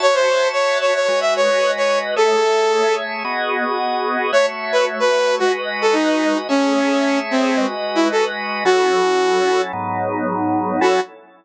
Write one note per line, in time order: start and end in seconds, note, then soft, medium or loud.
0.00 1.07 F#4 medium
0.00 1.07 C#5 medium
0.00 0.15 C#5 loud
0.00 1.07 E5 medium
0.00 1.07 A5 medium
0.15 0.48 C5 loud
0.53 0.78 C#5 medium
0.81 0.94 C#5 medium
0.95 1.20 C#5 medium
1.08 2.15 G#3 medium
1.08 2.15 F#4 medium
1.08 2.15 B4 medium
1.08 2.15 D#5 medium
1.21 1.34 E5 medium
1.36 1.71 C#5 loud
1.77 1.99 C#5 medium
2.16 3.23 A3 medium
2.16 3.23 G#4 medium
2.16 2.95 A4 loud
2.16 3.23 C#5 medium
2.16 3.23 E5 medium
3.24 4.31 B3 medium
3.24 4.31 F#4 medium
3.24 4.31 G#4 medium
3.24 4.31 D#5 medium
4.32 5.40 A3 medium
4.32 5.40 F#4 medium
4.32 5.40 C#5 medium
4.32 4.46 C#5 loud
4.32 5.40 E5 medium
4.72 4.85 B4 medium
5.00 5.35 B4 loud
5.39 6.48 G#3 medium
5.39 5.52 F#4 loud
5.39 6.48 F#4 medium
5.39 6.48 B4 medium
5.39 6.48 D#5 medium
5.82 5.95 A4 medium
5.93 6.38 D#4 medium
6.49 7.56 A3 medium
6.49 7.19 C#4 loud
6.49 7.56 G#4 medium
6.49 7.56 C#5 medium
6.49 7.56 E5 medium
7.31 7.66 C4 medium
7.57 8.64 G#3 medium
7.57 8.64 F#4 medium
7.57 8.64 B4 medium
7.57 8.64 D#5 medium
7.95 8.08 E4 medium
8.12 8.25 A4 medium
8.65 9.72 F#3 medium
8.65 9.72 C#4 medium
8.65 9.72 E4 medium
8.65 9.61 F#4 loud
8.65 9.72 A4 medium
9.73 10.80 G#2 medium
9.73 10.80 F#3 medium
9.73 10.80 B3 medium
9.73 10.80 D#4 medium
10.81 11.00 F#3 loud
10.81 11.00 C#4 medium
10.81 11.00 E4 loud
10.81 11.00 F#4 loud
10.81 11.00 A4 medium